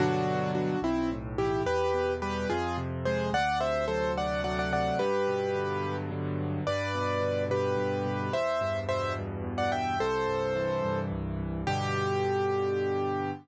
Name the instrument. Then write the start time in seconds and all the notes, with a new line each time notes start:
acoustic grand piano
0.00 G2 B2 D3 F#3 D4 F#4
0.55 D4 F#4
0.82 B1 C4 E4
1.12 A2
1.38 E3 E4 G4
1.66 E2 G4 B4
1.94 B2
2.22 G3 G4 B4
2.50 F2 F4 G#4
2.78 C3
3.05 G#3 G#4 C5
3.33 D2 D5 F#5
3.60 C3 C5 E5
3.88 F#3 A4 C5
4.17 A3 D5 F#5
4.44 F#3 D5 F#5
4.59 D5 F#5
4.73 C3 D5 F#5
4.99 G2 G4 B4
5.28 B2
5.55 D3
5.83 F#3
6.11 D3
6.39 B2
6.67 G2 B4 D5
6.95 B2
7.21 D3
7.50 B2 G4 B4
7.77 G2
8.06 B2
8.32 E2 C5 E5
8.61 G2
8.89 B2 C5 E5
9.18 G2
9.44 E2
9.58 D5 F#5
9.72 G2 E5 G5
10.00 C2 A4 C5
10.27 G2
10.56 E3
10.84 G2
11.12 C2
11.39 G2
11.67 G2 B2 D3 G4